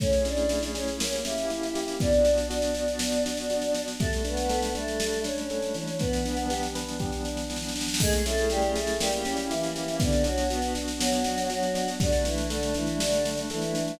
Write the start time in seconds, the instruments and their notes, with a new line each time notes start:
0.00 pad 5 (bowed) A3 C#4 E4 G#4, electric piano 1 A3, choir aahs C#4 C#5, kick, snare
0.13 snare
0.25 electric piano 1 C#4, choir aahs D4 D5, snare
0.37 snare
0.49 electric piano 1 E4, snare
0.63 snare
0.74 choir aahs C#4 C#5, electric piano 1 G#4, snare
0.88 snare
1.00 electric piano 1 A#3, pad 5 (bowed) A#3 C#4 E4 G4, snare
1.13 snare
1.24 electric piano 1 C#4, choir aahs E4 E5, snare
1.38 snare
1.50 electric piano 1 E4, snare
1.63 snare
1.75 electric piano 1 G4, snare
1.88 snare
2.00 pad 5 (bowed) B3 D4 F#4, electric piano 1 B3, choir aahs D4 D5, kick, snare
2.13 snare
2.25 electric piano 1 D4, snare
2.38 snare
2.50 choir aahs D4 D5, electric piano 1 F#4, snare
2.62 snare
2.74 choir aahs D4 D5, electric piano 1 D4, snare
2.88 snare
2.99 electric piano 1 B3, snare
3.12 snare
3.25 electric piano 1 D4, snare
3.37 snare
3.50 electric piano 1 F#4, snare
3.62 snare
3.74 electric piano 1 D4, snare
3.88 snare
3.99 electric piano 1 G3, pad 5 (bowed) G3 A3 D4, choir aahs A3 A4, kick, snare
4.13 snare
4.24 choir aahs B3 B4, electric piano 1 D4, snare
4.37 snare
4.49 electric piano 1 A4, snare
4.62 snare
4.74 choir aahs A3 A4, electric piano 1 D4, snare
4.88 snare
5.00 electric piano 1 G3, snare
5.13 snare
5.24 choir aahs C#4 C#5, electric piano 1 D4, snare
5.38 snare
5.50 electric piano 1 A4, snare
5.62 snare
5.74 electric piano 1 E3, snare
5.88 snare
5.99 pad 5 (bowed) E3 G3 B3 D4, choir aahs B3 B4, kick, snare
6.13 snare
6.25 electric piano 1 D4, snare
6.37 snare
6.50 electric piano 1 G4, snare
6.63 snare
6.75 electric piano 1 B4, snare
6.88 snare
6.99 electric piano 1 G4, kick, snare
7.12 snare
7.25 electric piano 1 D4, snare
7.37 snare
7.49 electric piano 1 E3, snare
7.56 snare
7.62 snare
7.69 snare
7.74 electric piano 1 D4, snare
7.81 snare
7.88 snare
7.94 snare
8.00 choir aahs G#3 G#4, electric piano 1 A3, pad 5 (bowed) A3 C#4 E4 G#4, kick, snare, crash
8.13 snare
8.25 choir aahs A3 A4, electric piano 1 C#4, snare
8.38 snare
8.50 choir aahs G3 G4, electric piano 1 E4, snare
8.62 snare
8.75 choir aahs A3 A4, electric piano 1 G#4, snare
8.87 snare
9.00 choir aahs G3 G4, pad 5 (bowed) A#3 C#4 E4 G4, electric piano 1 A#3, snare
9.12 snare
9.25 electric piano 1 C#4, snare
9.37 snare
9.50 choir aahs E3 E4, electric piano 1 E4, snare
9.63 snare
9.75 electric piano 1 G4, snare
9.88 snare
10.00 choir aahs D3 D4, pad 5 (bowed) B3 D4 F#4, electric piano 1 B3, kick, snare
10.12 snare
10.24 choir aahs F#3 F#4, electric piano 1 D4, snare
10.38 snare
10.50 choir aahs B3 B4, electric piano 1 F#4, snare
10.62 snare
10.75 electric piano 1 D4, snare
10.88 snare
11.00 choir aahs F#3 F#4, electric piano 1 B3, snare
11.12 snare
11.24 electric piano 1 D4, snare
11.38 snare
11.49 choir aahs F#3 F#4, electric piano 1 F#4, snare
11.63 snare
11.74 electric piano 1 D4, snare
11.88 snare
11.99 choir aahs D3 D4, pad 5 (bowed) G3 A3 D4, electric piano 1 G3, kick, snare
12.12 snare
12.25 choir aahs E3 E4, electric piano 1 D4, snare
12.38 snare
12.50 choir aahs D3 D4, electric piano 1 A4, snare
12.63 snare
12.74 choir aahs E3 E4, electric piano 1 D4, snare
12.87 snare
13.00 choir aahs D3 D4, electric piano 1 G3, snare
13.12 snare
13.25 electric piano 1 D4, snare
13.37 snare
13.50 choir aahs E3 E4, electric piano 1 A4, snare
13.62 snare
13.75 electric piano 1 D4, snare
13.88 snare